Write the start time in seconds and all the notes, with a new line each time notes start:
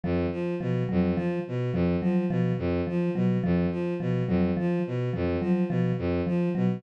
0.04 F2 F3
0.32 F3
0.60 B2 F3
0.89 F2 F#3
1.16 F3
1.48 B2
1.73 F2 F3
2.02 F3 F#3
2.30 B2 F3
2.58 F2
2.87 F3
3.15 B2 F#3
3.44 F2 F3
3.71 F3
4.00 B2 F3
4.28 F2 F#3
4.57 F3
4.87 B2
5.13 F2 F3
5.41 F3 F#3
5.69 B2 F3
5.98 F2
6.27 F3
6.55 B2 F#3